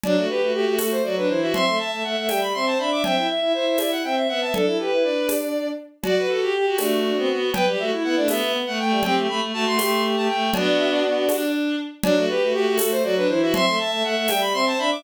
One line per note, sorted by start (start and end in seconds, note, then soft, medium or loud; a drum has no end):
0.03 0.16 F#3 medium
0.03 0.16 D4 medium
0.03 0.25 D5 loud
0.03 cowbell medium
0.03 low conga loud
0.16 0.28 A3 medium
0.16 0.28 F#4 medium
0.29 0.41 G4 medium
0.29 0.51 B4 medium
0.42 0.52 A3 medium
0.42 0.53 F#4 medium
0.53 0.65 A3 medium
0.53 0.65 F#4 medium
0.53 0.75 G4 medium
0.66 0.77 A3 medium
0.66 0.78 F#4 medium
0.78 1.01 A3 medium
0.78 0.91 F#4 medium
0.78 0.91 A4 medium
0.78 tambourine medium
0.78 cowbell medium
0.78 high conga medium
0.91 1.03 C5 medium
1.03 1.26 F#3 medium
1.03 1.15 F#4 medium
1.03 1.15 D5 medium
1.16 1.29 D4 medium
1.16 1.28 B4 medium
1.28 1.52 E3 medium
1.28 1.41 E4 medium
1.28 1.40 C5 medium
1.41 1.53 F#4 medium
1.41 1.53 E5 medium
1.53 1.65 C4 medium
1.53 1.65 E5 medium
1.53 1.75 C6 loud
1.53 cowbell medium
1.53 low conga loud
1.66 1.78 A3 medium
1.66 1.78 E5 medium
1.78 1.91 E5 medium
1.78 2.02 A5 medium
1.91 2.03 A3 medium
1.91 2.03 E5 medium
2.04 2.15 A3 medium
2.04 2.16 E5 medium
2.04 2.27 F#5 medium
2.17 2.29 A3 medium
2.17 2.29 E5 medium
2.28 2.53 G3 medium
2.28 2.41 E5 medium
2.28 2.40 G5 medium
2.28 tambourine medium
2.28 cowbell medium
2.28 high conga medium
2.41 2.53 B5 medium
2.54 2.75 C4 medium
2.54 2.66 E5 medium
2.54 2.66 C6 medium
2.65 2.77 C5 medium
2.65 2.78 A5 medium
2.78 3.02 D4 medium
2.78 2.89 E5 medium
2.78 2.91 B5 medium
2.90 3.02 E5 medium
2.90 3.03 D6 medium
3.03 3.16 C4 medium
3.03 3.15 E5 medium
3.03 3.27 G5 loud
3.03 cowbell loud
3.03 low conga loud
3.16 3.27 E4 medium
3.16 3.28 E5 medium
3.28 3.40 E5 medium
3.28 3.52 E5 medium
3.41 3.53 E4 medium
3.41 3.52 E5 medium
3.54 3.65 E4 medium
3.54 3.78 C5 medium
3.54 3.66 E5 medium
3.65 3.77 E4 medium
3.65 3.79 E5 medium
3.78 4.02 E4 medium
3.78 3.91 D5 medium
3.78 3.91 E5 medium
3.78 tambourine medium
3.78 cowbell medium
3.78 high conga medium
3.91 4.03 F#5 medium
4.04 4.26 C4 medium
4.04 4.15 E5 medium
4.04 4.16 G5 medium
4.16 4.27 E5 medium
4.16 4.28 E5 medium
4.28 4.52 B3 medium
4.28 4.40 E5 medium
4.28 4.41 F#5 medium
4.41 4.53 E5 medium
4.41 4.53 A5 medium
4.54 4.66 D4 medium
4.54 4.65 A4 medium
4.54 4.78 A4 medium
4.54 cowbell medium
4.54 low conga loud
4.66 4.77 E4 medium
4.66 4.78 A4 medium
4.78 4.90 G4 medium
4.78 5.27 B4 medium
4.91 5.04 E4 medium
4.91 5.03 B4 medium
5.03 5.71 D4 medium
5.03 5.69 D5 loud
5.29 tambourine medium
5.29 cowbell medium
5.29 high conga medium
6.03 6.26 F#4 medium
6.03 6.27 F#4 loud
6.03 6.15 D5 medium
6.03 cowbell loud
6.03 low conga loud
6.17 6.29 B4 medium
6.28 6.51 F#4 medium
6.28 6.40 A4 medium
6.41 6.53 G4 medium
6.53 6.77 G4 medium
6.53 6.65 G4 medium
6.65 6.77 F#4 medium
6.78 7.11 A3 medium
6.78 6.99 D4 medium
6.78 7.50 F#4 loud
6.78 tambourine medium
6.78 cowbell medium
6.78 high conga loud
7.04 7.16 D4 medium
7.16 7.28 B3 medium
7.16 7.28 C4 medium
7.28 7.49 B3 medium
7.53 7.65 B3 medium
7.53 7.65 B4 medium
7.53 7.66 G5 loud
7.53 cowbell loud
7.53 low conga loud
7.66 7.78 G3 medium
7.66 7.78 G4 medium
7.79 7.92 A3 medium
7.79 7.91 F#4 medium
7.79 7.91 E5 medium
7.91 8.03 E4 medium
8.03 8.16 B3 medium
8.03 8.15 E4 medium
8.03 8.16 F#5 medium
8.16 8.39 A3 medium
8.16 8.28 D4 medium
8.16 8.28 D5 loud
8.28 8.58 B3 medium
8.28 8.53 E5 loud
8.28 tambourine medium
8.28 cowbell medium
8.28 high conga loud
8.42 8.53 B3 medium
8.53 8.65 B3 medium
8.67 8.79 A3 medium
8.67 8.78 F#5 loud
8.79 8.91 A3 medium
8.79 9.00 A3 medium
8.79 9.03 G5 medium
8.90 9.02 G3 medium
9.03 9.15 C4 medium
9.03 9.27 G4 medium
9.03 9.16 G5 loud
9.03 cowbell loud
9.03 low conga loud
9.16 9.27 A3 medium
9.28 9.39 A3 medium
9.28 9.41 B5 medium
9.42 9.52 A3 medium
9.53 9.64 A3 medium
9.53 9.78 F#4 medium
9.53 9.66 A5 loud
9.66 9.78 A3 medium
9.66 9.78 C6 loud
9.79 10.15 A3 medium
9.79 10.01 G4 medium
9.79 10.03 C6 medium
9.79 tambourine medium
9.79 cowbell medium
9.79 high conga loud
10.04 10.15 G4 medium
10.16 10.28 A3 medium
10.16 10.28 G4 medium
10.16 10.28 A5 medium
10.28 10.50 A3 medium
10.28 10.51 G5 medium
10.53 11.02 B3 medium
10.53 11.36 D4 medium
10.53 11.02 D4 medium
10.53 11.36 F#4 medium
10.53 10.65 D5 loud
10.53 cowbell loud
10.53 low conga loud
10.66 10.78 D5 medium
10.78 10.90 E5 loud
10.91 11.51 D5 loud
11.03 11.25 B3 medium
11.28 11.75 D4 medium
11.28 tambourine medium
11.28 cowbell medium
11.28 high conga medium
12.03 12.15 F#3 loud
12.03 12.15 D4 loud
12.03 12.25 D5 loud
12.03 cowbell loud
12.03 low conga loud
12.16 12.28 A3 medium
12.16 12.28 F#4 medium
12.28 12.41 G4 medium
12.28 12.51 B4 loud
12.41 12.54 A3 medium
12.41 12.53 F#4 medium
12.53 12.66 A3 medium
12.53 12.65 F#4 medium
12.53 12.75 G4 loud
12.67 12.79 A3 medium
12.67 12.78 F#4 medium
12.78 13.03 A3 medium
12.78 12.90 F#4 medium
12.78 12.90 A4 medium
12.78 tambourine loud
12.78 cowbell medium
12.78 high conga loud
12.91 13.03 C5 loud
13.03 13.25 F#3 medium
13.03 13.15 F#4 medium
13.03 13.15 D5 loud
13.16 13.28 D4 medium
13.16 13.28 B4 loud
13.28 13.52 E3 medium
13.28 13.41 E4 medium
13.28 13.40 C5 loud
13.41 13.53 F#4 medium
13.41 13.53 E5 loud
13.53 13.65 C4 medium
13.53 13.65 E5 loud
13.53 13.75 C6 loud
13.53 cowbell loud
13.53 low conga loud
13.66 13.78 A3 medium
13.66 13.78 E5 medium
13.79 13.91 E5 medium
13.79 14.03 A5 loud
13.91 14.03 A3 medium
13.91 14.03 E5 medium
14.03 14.15 A3 medium
14.03 14.15 E5 medium
14.03 14.27 F#5 loud
14.15 14.27 A3 medium
14.15 14.29 E5 medium
14.28 14.54 G3 medium
14.28 14.41 E5 medium
14.28 14.41 G5 loud
14.28 tambourine medium
14.28 cowbell medium
14.28 high conga loud
14.41 14.53 B5 loud
14.53 14.74 C4 medium
14.53 14.65 E5 medium
14.53 14.65 C6 loud
14.66 14.78 C5 medium
14.66 14.78 A5 loud
14.78 15.03 D4 medium
14.78 14.90 E5 medium
14.78 14.91 B5 loud
14.91 15.03 E5 medium
14.91 15.03 D6 loud